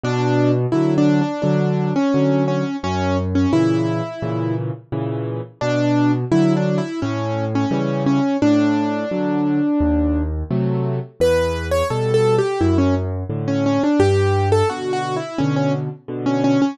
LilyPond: <<
  \new Staff \with { instrumentName = "Acoustic Grand Piano" } { \time 4/4 \key b \minor \tempo 4 = 86 d'8. r16 \tuplet 3/2 { e'8 d'8 d'8 } d'8. cis'8. cis'8 | cis'8 r16 cis'16 e'4. r4. | d'8. r16 \tuplet 3/2 { e'8 d'8 e'8 } cis'8. cis'8. cis'8 | d'2. r4 |
b'8. cis''16 \tuplet 3/2 { a'8 a'8 g'8 } e'16 cis'16 r8. cis'16 cis'16 d'16 | g'8. a'16 \tuplet 3/2 { fis'8 fis'8 e'8 } cis'16 cis'16 r8. cis'16 cis'16 cis'16 | }
  \new Staff \with { instrumentName = "Acoustic Grand Piano" } { \time 4/4 \key b \minor b,4 <d fis>4 <d fis>4 <d fis>4 | fis,4 <ais, cis e>4 <ais, cis e>4 <ais, cis e>4 | b,4 <d fis>4 a,4 <cis e g>4 | a,4 <d fis>4 dis,4 <c fis a>4 |
e,4 <b, g>4 fis,4 <a, d>4 | g,4 <b, d>4 <b, d>4 <b, d>4 | }
>>